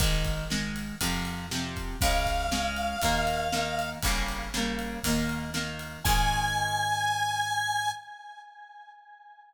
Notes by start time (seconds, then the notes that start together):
0.00 G#1 D#3 G#3, kick, ride
0.25 kick, ride
0.50 D#3 G#3, snare
0.76 ride
1.01 F2 C3 F3, kick, ride
1.25 ride
1.51 C3 F3, snare
1.76 kick, ride
2.01 C#2 C#3 G#3 F5, kick, ride
2.26 kick, ride
2.51 C#3 G#3, snare
2.76 ride
3.02 D#2 D#3 A#3, kick, ride
3.27 ride
3.52 D#3 A#3, snare
3.79 ride
4.03 G1 C#3 G3 A#3, kick, ride
4.28 ride
4.54 C#3 G3 A#3, snare
4.79 ride
5.04 D#2 D#3 A#3, kick, ride
5.29 ride
5.54 D#3 A#3, snare
5.79 ride
6.04 G#2 D#3 G#3 G#5, kick, crash